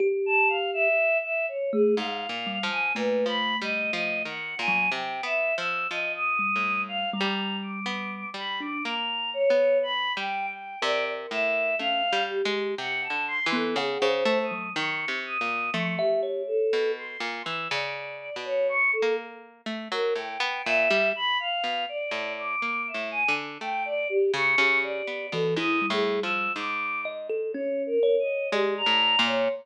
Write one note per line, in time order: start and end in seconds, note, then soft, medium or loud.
0.00 0.88 G4 loud
0.26 0.48 A5 loud
0.48 0.70 F5 medium
0.73 1.18 E5 loud
1.24 1.46 E5 medium
1.48 1.70 C#5 medium
1.73 1.95 A3 medium
1.73 1.95 G#4 loud
1.96 2.27 G#2 medium
1.96 2.63 F5 medium
2.29 2.59 A#2 medium
2.47 2.69 G3 medium
2.63 2.93 F3 medium
2.70 2.93 G#5 loud
2.95 3.25 A#2 medium
2.95 4.28 A3 medium
2.95 3.25 B4 medium
3.26 3.55 F3 medium
3.26 3.57 B5 medium
3.61 3.91 G3 medium
3.61 3.92 D#5 medium
3.93 4.23 F3 medium
3.93 4.22 D#5 medium
4.25 4.55 D#3 medium
4.25 4.55 F#5 medium
4.59 4.89 A#2 medium
4.59 4.90 G#5 loud
4.68 4.90 F#3 loud
4.92 5.21 C3 medium
4.92 5.22 G5 medium
5.23 5.53 B3 medium
5.23 5.55 E5 medium
5.58 5.87 F3 medium
5.58 5.87 E6 medium
5.90 6.50 F3 medium
5.90 6.13 D#5 medium
6.15 6.81 D#6 loud
6.39 7.05 G3 medium
6.56 7.15 A2 medium
6.88 7.10 F5 medium
7.13 8.24 G3 loud
7.13 7.57 A#5 medium
7.21 7.80 G3 loud
7.63 8.29 D6 medium
7.86 8.30 B3 medium
8.34 8.78 G3 medium
8.34 8.59 B5 medium
8.60 8.82 D4 medium
8.60 8.83 D6 medium
8.85 9.44 A#3 medium
8.85 9.30 A#5 medium
9.34 9.78 C#5 loud
9.50 10.09 B3 medium
9.83 10.13 B5 medium
10.17 10.76 G3 medium
10.17 10.46 G5 loud
10.49 10.78 G5 medium
10.82 11.27 C3 loud
10.82 11.70 A#4 medium
10.82 11.05 D5 loud
11.31 11.75 A2 medium
11.31 11.75 E5 medium
11.79 12.09 A3 medium
11.79 12.02 C#4 medium
11.79 12.23 F5 loud
12.13 12.42 G3 loud
12.30 12.74 G4 medium
12.45 12.75 G#3 loud
12.78 13.08 C3 medium
12.78 13.01 F#5 medium
13.03 13.25 A5 medium
13.10 13.40 D3 medium
13.28 13.50 C6 loud
13.46 13.76 E3 loud
13.52 13.75 B3 loud
13.52 13.76 A4 medium
13.76 13.98 C#3 loud
13.76 14.07 G#4 medium
13.76 13.99 F#5 medium
14.02 14.24 C#3 loud
14.02 14.46 C5 loud
14.09 14.38 C5 medium
14.25 14.70 A3 loud
14.43 14.72 D#6 medium
14.51 14.74 F#3 medium
14.75 15.06 D#3 loud
14.75 15.19 C#6 medium
15.08 15.38 C3 medium
15.26 15.70 D#6 medium
15.41 15.70 A#2 medium
15.73 15.96 F3 loud
15.73 16.62 A3 medium
15.73 15.95 C#6 medium
15.98 16.42 G4 medium
15.98 16.21 E5 loud
16.23 16.67 C#5 medium
16.47 16.91 A4 medium
16.73 17.17 B2 medium
16.98 17.42 C6 medium
17.20 17.42 A#2 medium
17.45 17.68 E3 medium
17.45 17.67 E6 medium
17.70 18.30 C#3 loud
17.70 18.36 D5 medium
18.36 18.95 B2 medium
18.45 18.67 C#5 medium
18.69 18.91 C#6 loud
18.93 19.15 A4 medium
19.02 19.61 A#3 medium
19.66 19.88 A3 medium
19.92 20.14 F#3 loud
19.92 20.14 A#4 medium
20.16 20.38 A2 medium
20.16 20.61 G5 medium
20.40 20.62 B3 loud
20.65 20.89 A#2 medium
20.65 21.09 E5 loud
20.91 21.13 G3 loud
21.16 21.38 B5 loud
21.40 21.84 F5 medium
21.64 21.86 B2 medium
21.89 22.33 D5 medium
22.11 22.56 A2 medium
22.39 22.83 D6 loud
22.62 22.92 A#3 medium
22.87 23.09 E5 soft
22.94 23.24 A2 medium
23.11 23.33 G#5 loud
23.28 23.58 D3 medium
23.61 24.05 A3 medium
23.61 23.83 G5 loud
23.85 24.08 D5 loud
24.09 24.32 G4 loud
24.34 24.56 C#3 loud
24.34 24.78 C#6 loud
24.58 25.02 C#3 loud
24.58 25.26 G4 medium
24.83 25.27 D5 medium
25.07 25.30 B3 medium
25.32 25.55 B2 medium
25.32 25.55 E3 loud
25.32 25.54 A4 medium
25.56 25.86 G#2 medium
25.56 25.80 E4 loud
25.56 25.86 D#6 medium
25.82 26.48 G3 medium
25.90 26.20 A2 medium
25.90 26.20 G#4 medium
26.22 26.53 F3 medium
26.22 26.52 E6 medium
26.56 28.33 G#2 medium
26.56 27.01 D6 loud
27.05 27.27 D#5 medium
27.30 27.52 A4 medium
27.53 27.99 C#4 medium
27.53 27.83 C#5 medium
27.86 28.16 A#4 loud
28.03 28.47 C#5 medium
28.19 28.49 D#5 medium
28.52 28.82 G#3 loud
28.52 28.74 G4 medium
28.52 29.19 D5 loud
28.77 29.22 A#5 loud
28.86 29.16 A2 medium
29.19 29.48 A#2 loud
29.26 29.49 C#5 medium